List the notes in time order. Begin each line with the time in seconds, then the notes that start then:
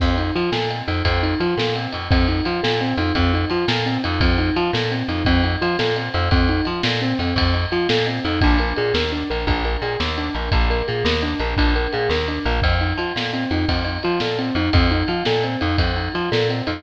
0.00 F2 C4, kick, crash
0.18 D#4, ride
0.35 F3 F4, ride
0.52 A#2 A4, snare
0.70 C4, ride
0.88 F2 D#4, ride
1.05 F2 C4, kick, ride
1.23 D#4, ride
1.40 F3 F4, ride
1.57 A#2 A4, snare
1.75 C4, ride
1.92 F2 D#4, ride
2.10 F2 C4, kick, ride
2.28 D#4, ride
2.45 F3 F4, ride
2.63 A#2 A4, snare
2.81 C4, ride
2.97 F2 D#4, ride
3.15 F2 C4, kick, ride
3.33 D#4, ride
3.50 F3 F4, ride
3.68 A#2 A4, snare
3.86 C4, ride
4.04 F2 D#4, ride
4.20 F2 C4, kick, ride
4.38 D#4, ride
4.56 F3 F4, ride
4.73 A#2 A4, snare
4.91 C4, ride
5.08 F2 D#4, ride
5.25 F2 C4, kick, ride
5.44 D#4, ride
5.61 F3 F4, ride
5.79 A#2 A4, snare
5.96 C4, ride
6.14 F2 D#4, ride
6.31 F2 C4, kick, ride
6.49 D#4, ride
6.65 F3 F4, ride
6.83 A#2 A4, snare
7.01 C4, ride
7.19 F2 C4, ride
7.36 F2, kick, ride
7.54 D#4, ride
7.72 F3 F4, ride
7.89 A#2 A4, snare
8.07 C4, ride
8.25 F2 D#4, ride
8.41 A#1 D4, kick, ride
8.58 A#4, ride
8.76 A#2 G#4, ride
8.94 D#2 A#4, snare
9.12 D4, ride
9.30 A#1 A#4, ride
9.47 A#1 D4, kick, ride
9.65 A#4, ride
9.82 A#2 G#4, ride
10.00 D#2 A#4, snare
10.18 D4, ride
10.35 A#1 A#4, ride
10.52 A#1 D4, kick, ride
10.70 A#4, ride
10.88 A#2 G#4, ride
11.05 D#2 A#4, snare
11.22 D4, ride
11.39 A#1 A#4, ride
11.57 A#1 D4, kick, ride
11.76 A#4, ride
11.93 A#2 G#4, ride
12.09 D#2 A#4, snare
12.28 D4, ride
12.45 A#1 A#4, ride
12.62 F2 C4, kick, ride
12.81 D#4, ride
12.98 F3 F4, ride
13.16 A#2 A4, snare
13.33 C4, ride
13.51 F2 D#4, ride
13.68 F2 C4, kick, ride
13.84 D#4, ride
14.03 F3 F4, ride
14.20 A#2 A4, snare
14.39 C4, ride
14.55 F2 D#4, ride
14.73 F2 C4, kick, ride
14.91 D#4, ride
15.08 F3 F4, ride
15.25 A#2 A4, snare
15.43 C4, ride
15.61 F2 D#4, ride
15.78 F2 C4, kick, ride
15.96 D#4, ride
16.14 F3 F4, ride
16.32 A#2 A4, snare
16.49 C4, ride
16.67 F2 D#4, ride